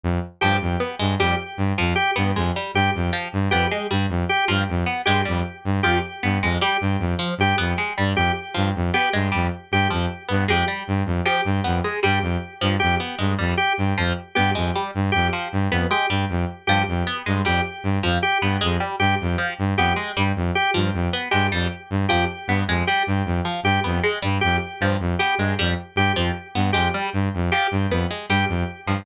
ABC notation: X:1
M:5/4
L:1/8
Q:1/4=155
K:none
V:1 name="Lead 2 (sawtooth)" clef=bass
F,, z G,, F,, z G,, F,, z G,, F,, | z G,, F,, z G,, F,, z G,, F,, z | G,, F,, z G,, F,, z G,, F,, z G,, | F,, z G,, F,, z G,, F,, z G,, F,, |
z G,, F,, z G,, F,, z G,, F,, z | G,, F,, z G,, F,, z G,, F,, z G,, | F,, z G,, F,, z G,, F,, z G,, F,, | z G,, F,, z G,, F,, z G,, F,, z |
G,, F,, z G,, F,, z G,, F,, z G,, | F,, z G,, F,, z G,, F,, z G,, F,, | z G,, F,, z G,, F,, z G,, F,, z | G,, F,, z G,, F,, z G,, F,, z G,, |
F,, z G,, F,, z G,, F,, z G,, F,, | z G,, F,, z G,, F,, z G,, F,, z | G,, F,, z G,, F,, z G,, F,, z G,, |]
V:2 name="Orchestral Harp"
z2 F, z B, ^G, =G, z2 F, | z B, ^G, =G, z2 F, z B, ^G, | G, z2 F, z B, ^G, =G, z2 | F, z B, ^G, =G, z2 F, z B, |
^G, =G, z2 F, z B, ^G, =G, z | z F, z B, ^G, =G, z2 F, z | B, ^G, =G, z2 F, z B, ^G, =G, | z2 F, z B, ^G, =G, z2 F, |
z B, ^G, =G, z2 F, z B, ^G, | G, z2 F, z B, ^G, =G, z2 | F, z B, ^G, =G, z2 F, z B, | ^G, =G, z2 F, z B, ^G, =G, z |
z F, z B, ^G, =G, z2 F, z | B, ^G, =G, z2 F, z B, ^G, =G, | z2 F, z B, ^G, =G, z2 F, |]
V:3 name="Drawbar Organ"
z2 G z3 G z3 | G z3 G z3 G z | z2 G z3 G z3 | G z3 G z3 G z |
z2 G z3 G z3 | G z3 G z3 G z | z2 G z3 G z3 | G z3 G z3 G z |
z2 G z3 G z3 | G z3 G z3 G z | z2 G z3 G z3 | G z3 G z3 G z |
z2 G z3 G z3 | G z3 G z3 G z | z2 G z3 G z3 |]